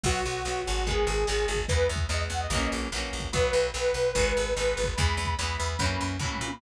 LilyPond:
<<
  \new Staff \with { instrumentName = "Lead 2 (sawtooth)" } { \time 4/4 \key b \major \tempo 4 = 146 fis'8 fis'4 fis'8 gis'2 | b'8 r8 dis''16 r16 fis''16 dis''8. r4. | b'4 b'2 b'4 | b''4 b''2 b''4 | }
  \new Staff \with { instrumentName = "Acoustic Guitar (steel)" } { \time 4/4 \key b \major <fis b>4 <fis b>4 <dis gis b>4 <dis gis b>4 | <e gis b>4 <e gis b>4 <e fis ais cis'>4 <e fis ais cis'>4 | <fis b>4 <fis b>4 <dis gis b>4 <dis gis b>4 | <e gis b>4 <e gis b>4 <e fis ais cis'>4 <e fis ais cis'>4 | }
  \new Staff \with { instrumentName = "Electric Bass (finger)" } { \clef bass \time 4/4 \key b \major b,,8 b,,8 b,,8 gis,,4 gis,,8 gis,,8 gis,,8 | e,8 e,8 e,8 e,8 ais,,8 ais,,8 ais,,8 ais,,8 | b,,8 b,,8 b,,8 b,,8 gis,,8 gis,,8 gis,,8 gis,,8 | e,8 e,8 e,8 e,8 fis,8 fis,8 a,8 ais,8 | }
  \new DrumStaff \with { instrumentName = "Drums" } \drummode { \time 4/4 \tuplet 3/2 { <cymc bd>8 r8 hh8 sn8 r8 hh8 <hh bd>8 r8 hh8 sn8 r8 <hh bd>8 } | \tuplet 3/2 { <hh bd>8 r8 <hh bd>8 sn8 r8 hh8 <hh bd>8 r8 hh8 sn8 r8 <hh bd>8 } | \tuplet 3/2 { <hh bd>8 r8 hh8 sn8 r8 hh8 <hh bd>8 r8 hh8 sn8 r8 <hh bd>8 } | \tuplet 3/2 { <hh bd>8 r8 <hh bd>8 sn8 r8 hh8 <hh bd>8 r8 hh8 <bd tomfh>8 toml8 tommh8 } | }
>>